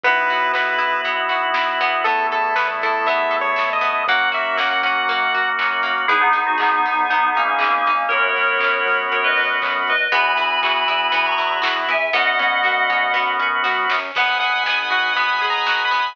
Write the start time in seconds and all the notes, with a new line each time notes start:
0.03 B1 B3 E4 F#4 B4, kick, closed hi-hat
0.16 closed hi-hat
0.29 F#4, open hi-hat
0.41 closed hi-hat
0.53 B3 B4, kick, snare
0.67 closed hi-hat
0.78 E4, open hi-hat
0.93 closed hi-hat
1.04 B1 B3, kick, closed hi-hat
1.17 closed hi-hat
1.29 F#4, open hi-hat
1.43 closed hi-hat
1.54 E4, kick, snare
1.68 closed hi-hat
1.80 E2 B3, open hi-hat
1.93 closed hi-hat
2.04 A3 B3 E4 A4, kick, closed hi-hat
2.18 closed hi-hat
2.31 A4, open hi-hat
2.44 closed hi-hat
2.56 B3 B4, kick, snare
2.82 E4 A4, open hi-hat
2.94 closed hi-hat
3.06 B3 E5, kick, closed hi-hat
3.18 closed hi-hat
3.31 A4, open hi-hat
3.41 C#5, closed hi-hat
3.56 E4, kick, snare
3.70 D#5, closed hi-hat
3.81 B3, open hi-hat
3.95 closed hi-hat
4.07 F#2 A#3 C#4 F#4 F#5, kick, closed hi-hat
4.19 closed hi-hat
4.32 F#4 E5, open hi-hat
4.45 closed hi-hat
4.57 A#3 F#5, kick, snare
4.70 F#5, closed hi-hat
4.83 C#4 F#5, open hi-hat
4.97 closed hi-hat
5.07 A#3, kick, closed hi-hat
5.20 closed hi-hat
5.34 F#4, open hi-hat
5.46 closed hi-hat
5.59 C#4, kick, clap
5.71 closed hi-hat
5.83 A#3, open hi-hat
5.98 closed hi-hat
6.08 G#1 B3 D#4 E4 G#4, kick, closed hi-hat
6.21 B3 D#4
6.33 G#1 D#4, open hi-hat
6.47 D#4 F#4
6.58 G#1 B3 D#4 G#4, kick, clap
6.85 G#1 D#4, open hi-hat
7.10 G#1 B3 D#4, kick, closed hi-hat
7.35 G#1 A#3 C#4 D#4, open hi-hat
7.48 A#3 C#4
7.59 G#1 A#3 C#4 G#4, kick, clap
7.71 A#3 C#4
7.86 G#1 D#4, open hi-hat
8.09 F#2 B3 C#4 F#4 A#4 C#5, kick, closed hi-hat
8.36 F#2, open hi-hat
8.60 F#2, kick, clap
8.85 F#2, open hi-hat
9.11 F#2 A#4 C#5, kick, closed hi-hat
9.24 B4 D#5
9.37 F#2, open hi-hat
9.62 F#2, kick, clap
9.87 F#2 B4 D#5, open hi-hat
10.12 E2 B3 E4 F#4 G#5 B5, kick, closed hi-hat
10.37 E2 E4, open hi-hat
10.63 E2 F#4, kick, clap
10.88 E2 E4, open hi-hat
11.12 E2 B3 G#5 B5, kick, closed hi-hat
11.26 A#5 C#6
11.38 E2 E4, open hi-hat
11.62 E2 F#4, kick, snare
11.88 E2 E4 E5 G#5, open hi-hat
12.13 F#2 B3 C#4 F#4 D#5 F#5, kick, snare
12.39 F#2 C#4, high tom
12.63 F#2 F#4, snare
12.90 F#2 C#4, mid tom
13.14 F#2 B3, snare
13.39 F#2 C#4, floor tom
13.64 F#2 F#4, snare
13.89 F#2 C#4, snare
14.15 G#1 B3 B4 D#5 F#5 G#5, kick, crash
14.29 closed hi-hat
14.40 G#4 F#5, open hi-hat
14.53 closed hi-hat
14.66 B3 G#5, snare
14.78 closed hi-hat
14.90 F#4 F#5, kick, open hi-hat
15.04 closed hi-hat
15.16 B3 B5, kick, closed hi-hat
15.30 closed hi-hat
15.42 G#4, open hi-hat
15.50 A#5
15.54 closed hi-hat
15.66 F#4, kick, snare
15.80 closed hi-hat
15.85 B5
15.91 B3, open hi-hat
16.06 open hi-hat